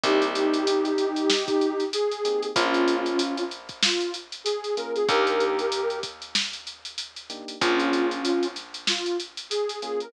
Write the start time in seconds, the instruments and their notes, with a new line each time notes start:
0.04 electric bass (finger) C2, electric piano 1 A#3 C4 D#4 G4, ocarina D#4 G4, kick, closed hi-hat
0.22 closed hi-hat
0.35 closed hi-hat
0.54 closed hi-hat
0.67 closed hi-hat
0.85 closed hi-hat
0.98 closed hi-hat
1.16 closed hi-hat
1.30 snare
1.48 kick, closed hi-hat
1.61 closed hi-hat
1.80 closed hi-hat
1.93 ocarina G#4, closed hi-hat
2.12 closed hi-hat
2.25 electric piano 1 A#3 C4 D#4 G4, closed hi-hat
2.43 closed hi-hat
2.55 electric bass (finger) A#1, electric piano 1 A#3 C#4 F4 G#4, ocarina C#4 F4, kick, closed hi-hat
2.74 closed hi-hat
2.88 closed hi-hat
3.06 closed hi-hat
3.19 closed hi-hat
3.38 closed hi-hat
3.51 closed hi-hat
3.69 kick, closed hi-hat
3.83 ocarina F4, snare
4.01 closed hi-hat
4.14 closed hi-hat
4.32 closed hi-hat
4.44 ocarina G#4, closed hi-hat
4.64 closed hi-hat
4.77 electric piano 1 A#3 C#4 F4 G#4, ocarina A#4, closed hi-hat
4.96 ocarina G#4, closed hi-hat
5.09 electric bass (finger) D#2, electric piano 1 A#3 D4 D#4 G4, ocarina G4 A#4, kick, closed hi-hat
5.27 closed hi-hat
5.40 closed hi-hat
5.59 closed hi-hat
5.72 closed hi-hat
5.90 closed hi-hat
6.03 kick, closed hi-hat
6.22 closed hi-hat
6.35 snare
6.53 closed hi-hat
6.67 closed hi-hat
6.85 closed hi-hat
6.98 closed hi-hat
7.16 closed hi-hat
7.30 electric piano 1 A#3 D4 D#4 G4, closed hi-hat
7.48 closed hi-hat
7.61 electric bass (finger) A#1, electric piano 1 A#3 C#4 F4 G#4, ocarina C#4 F4, kick, closed hi-hat
7.80 closed hi-hat
7.93 closed hi-hat
8.11 closed hi-hat
8.25 closed hi-hat
8.43 closed hi-hat
8.56 snare, closed hi-hat
8.74 closed hi-hat
8.87 ocarina F4, snare
9.06 closed hi-hat
9.20 closed hi-hat
9.37 closed hi-hat
9.50 ocarina G#4, closed hi-hat
9.69 closed hi-hat
9.82 electric piano 1 A#3 C#4 F4 G#4, ocarina G#4, closed hi-hat
10.00 ocarina A#4, closed hi-hat